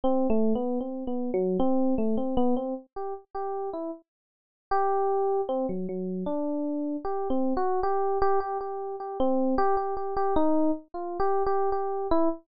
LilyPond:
\new Staff { \time 5/4 \partial 4 \tempo 4 = 77 \tuplet 3/2 { c'8 a8 b8 } | \tuplet 3/2 { c'8 b8 fis8 } c'8 a16 c'16 b16 c'16 r16 g'16 r16 g'8 e'16 r4 | g'4 c'16 fis16 fis8 d'4 \tuplet 3/2 { g'8 c'8 fis'8 } g'8 g'16 g'16 | g'8 g'16 c'8 g'16 g'16 g'16 g'16 dis'8 r16 \tuplet 3/2 { f'8 g'8 g'8 } g'8 e'16 r16 | }